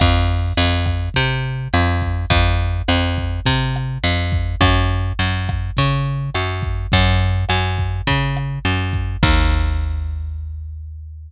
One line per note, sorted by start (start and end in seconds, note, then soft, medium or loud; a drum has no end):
0.00 0.53 F2 loud
0.00 kick medium
0.00 cross-stick medium
0.00 crash medium
0.28 closed hi-hat medium
0.57 1.09 F2 medium
0.57 closed hi-hat loud
0.86 kick medium
0.86 cross-stick medium
0.86 closed hi-hat medium
1.14 1.68 C3 medium
1.14 kick medium
1.14 closed hi-hat medium
1.45 closed hi-hat soft
1.73 2.25 F2 medium
1.73 cross-stick medium
1.73 closed hi-hat medium
2.02 kick medium
2.02 open hi-hat medium
2.30 2.82 F2 medium
2.30 kick medium
2.30 closed hi-hat medium
2.60 closed hi-hat medium
2.88 3.40 F2 medium
2.88 cross-stick medium
2.88 closed hi-hat medium
3.17 kick medium
3.17 closed hi-hat medium
3.46 3.98 C3 medium
3.46 kick medium
3.46 closed hi-hat medium
3.75 cross-stick medium
3.75 closed hi-hat medium
4.03 4.56 F2 medium
4.03 closed hi-hat medium
4.32 kick medium
4.32 closed hi-hat medium
4.61 5.13 F#2 loud
4.61 kick medium
4.61 cross-stick loud
4.61 closed hi-hat medium
4.91 closed hi-hat medium
5.19 5.71 F#2 medium
5.19 closed hi-hat loud
5.47 kick medium
5.47 cross-stick medium
5.47 closed hi-hat medium
5.77 6.30 C#3 medium
5.77 kick medium
5.77 closed hi-hat medium
6.06 closed hi-hat medium
6.34 6.87 F#2 medium
6.34 cross-stick medium
6.34 closed hi-hat medium
6.62 kick medium
6.62 closed hi-hat medium
6.92 7.45 F#2 loud
6.92 kick medium
6.92 closed hi-hat medium
7.20 closed hi-hat medium
7.49 8.01 F#2 medium
7.49 cross-stick medium
7.49 closed hi-hat medium
7.78 kick medium
7.78 closed hi-hat medium
8.07 8.59 C#3 medium
8.07 kick medium
8.07 closed hi-hat medium
8.36 cross-stick medium
8.36 closed hi-hat medium
8.65 9.17 F#2 medium
8.65 closed hi-hat medium
8.93 kick medium
8.93 closed hi-hat medium
9.23 11.31 D#2 loud
9.23 kick loud
9.23 crash loud